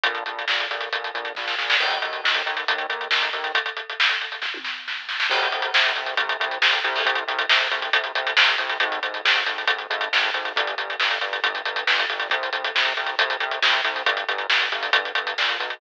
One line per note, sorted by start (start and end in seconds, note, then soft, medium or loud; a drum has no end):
0.03 0.24 A#1 medium
0.03 kick medium
0.03 closed hi-hat medium
0.15 closed hi-hat soft
0.26 0.45 A#1 medium
0.26 closed hi-hat medium
0.39 closed hi-hat soft
0.48 0.67 A#1 medium
0.48 snare medium
0.60 closed hi-hat medium
0.71 0.89 A#1 medium
0.71 closed hi-hat medium
0.81 closed hi-hat medium
0.93 1.11 A#1 medium
0.93 kick medium
0.93 closed hi-hat medium
1.04 closed hi-hat medium
1.14 1.33 A#1 medium
1.14 closed hi-hat medium
1.25 closed hi-hat soft
1.35 1.55 A#1 medium
1.35 kick medium
1.35 snare medium
1.48 snare medium
1.58 1.77 A#1 medium
1.58 snare medium
1.70 snare medium
1.80 1.99 D#2 medium
1.80 kick medium
1.80 crash medium
1.91 closed hi-hat medium
2.02 2.21 D#2 medium
2.02 closed hi-hat medium
2.13 closed hi-hat soft
2.24 2.42 D#2 medium
2.24 snare medium
2.34 closed hi-hat medium
2.46 2.65 D#2 medium
2.46 closed hi-hat medium
2.57 closed hi-hat medium
2.68 2.87 D#2 medium
2.68 kick medium
2.68 closed hi-hat medium
2.78 closed hi-hat medium
2.89 3.08 D#2 medium
2.89 closed hi-hat medium
3.01 closed hi-hat soft
3.11 3.30 D#2 medium
3.11 snare medium
3.22 closed hi-hat medium
3.33 3.52 D#2 medium
3.33 closed hi-hat medium
3.44 closed hi-hat medium
3.55 kick medium
3.55 closed hi-hat medium
3.66 closed hi-hat medium
3.77 closed hi-hat medium
3.90 closed hi-hat medium
4.00 snare medium
4.09 closed hi-hat medium
4.21 closed hi-hat soft
4.32 closed hi-hat soft
4.42 kick medium
4.42 snare medium
4.54 high tom medium
4.65 snare medium
4.88 snare medium
5.09 snare medium
5.20 snare medium
5.30 5.49 C2 loud
5.30 kick medium
5.30 crash medium
5.43 closed hi-hat medium
5.52 5.71 C2 medium
5.52 closed hi-hat medium
5.62 closed hi-hat medium
5.74 5.93 C2 medium
5.74 snare loud
5.86 closed hi-hat medium
5.96 6.15 C2 medium
5.96 closed hi-hat medium
6.06 closed hi-hat medium
6.17 6.37 C2 medium
6.17 kick medium
6.17 closed hi-hat medium
6.29 closed hi-hat medium
6.40 6.58 C2 medium
6.40 closed hi-hat medium
6.51 closed hi-hat medium
6.61 6.80 C2 medium
6.61 snare medium
6.73 closed hi-hat medium
6.84 7.03 C2 loud
6.84 closed hi-hat medium
6.96 open hi-hat medium
7.05 7.24 C2 medium
7.05 kick medium
7.05 closed hi-hat medium
7.15 closed hi-hat medium
7.27 7.46 C2 medium
7.27 closed hi-hat medium
7.39 closed hi-hat medium
7.49 7.68 C2 medium
7.49 snare loud
7.60 closed hi-hat medium
7.71 7.90 C2 medium
7.71 closed hi-hat medium
7.82 closed hi-hat medium
7.93 8.12 C2 medium
7.93 kick medium
7.93 closed hi-hat medium
8.04 closed hi-hat medium
8.15 8.34 C2 medium
8.15 closed hi-hat medium
8.27 closed hi-hat medium
8.37 8.56 C2 medium
8.37 snare loud
8.48 closed hi-hat medium
8.58 8.78 C2 medium
8.58 closed hi-hat medium
8.70 closed hi-hat medium
8.80 9.00 G#1 loud
8.80 kick medium
8.80 closed hi-hat medium
8.92 closed hi-hat medium
9.03 9.21 G#1 medium
9.03 closed hi-hat medium
9.14 closed hi-hat medium
9.25 9.43 G#1 medium
9.25 snare medium
9.36 closed hi-hat medium
9.46 9.65 G#1 medium
9.46 closed hi-hat medium
9.58 closed hi-hat medium
9.68 9.87 G#1 medium
9.68 kick medium
9.68 closed hi-hat medium
9.78 closed hi-hat soft
9.90 10.09 G#1 medium
9.90 closed hi-hat medium
10.01 closed hi-hat medium
10.12 10.31 G#1 medium
10.12 snare medium
10.23 closed hi-hat medium
10.34 10.53 G#1 medium
10.34 closed hi-hat medium
10.45 closed hi-hat medium
10.56 10.75 G1 medium
10.56 kick medium
10.56 closed hi-hat medium
10.67 closed hi-hat medium
10.78 10.96 G1 medium
10.78 closed hi-hat medium
10.90 closed hi-hat medium
11.00 11.19 G1 medium
11.00 snare medium
11.11 closed hi-hat medium
11.21 11.41 G1 medium
11.21 closed hi-hat medium
11.33 closed hi-hat medium
11.44 11.62 G1 medium
11.44 kick medium
11.44 closed hi-hat medium
11.55 closed hi-hat medium
11.65 11.84 G1 medium
11.65 closed hi-hat medium
11.76 closed hi-hat medium
11.87 12.06 G1 medium
11.87 snare medium
11.99 closed hi-hat medium
12.09 12.28 G1 medium
12.09 closed hi-hat medium
12.20 closed hi-hat medium
12.30 12.50 C2 medium
12.30 kick medium
12.30 closed hi-hat medium
12.43 closed hi-hat medium
12.53 12.72 C2 medium
12.53 closed hi-hat medium
12.65 closed hi-hat medium
12.75 12.94 C2 medium
12.75 snare medium
12.85 closed hi-hat medium
12.97 13.16 C2 medium
12.97 closed hi-hat medium
13.06 closed hi-hat medium
13.18 13.37 C2 medium
13.18 kick medium
13.18 closed hi-hat medium
13.30 closed hi-hat medium
13.40 13.59 C2 medium
13.40 closed hi-hat medium
13.51 closed hi-hat medium
13.62 13.81 C2 medium
13.62 snare loud
13.72 closed hi-hat medium
13.84 14.03 C2 medium
13.84 closed hi-hat medium
13.96 closed hi-hat medium
14.06 14.25 G1 medium
14.06 kick medium
14.06 closed hi-hat medium
14.17 closed hi-hat medium
14.29 14.47 G1 medium
14.29 closed hi-hat medium
14.38 closed hi-hat medium
14.50 14.69 G1 medium
14.50 snare medium
14.61 closed hi-hat medium
14.72 14.90 G1 medium
14.72 closed hi-hat medium
14.83 closed hi-hat medium
14.93 15.12 G1 medium
14.93 kick medium
14.93 closed hi-hat medium
15.05 closed hi-hat medium
15.15 15.34 G1 medium
15.15 closed hi-hat medium
15.27 closed hi-hat medium
15.38 15.58 A#1 medium
15.38 snare medium
15.49 closed hi-hat medium
15.60 15.79 B1 medium
15.60 closed hi-hat medium
15.70 closed hi-hat medium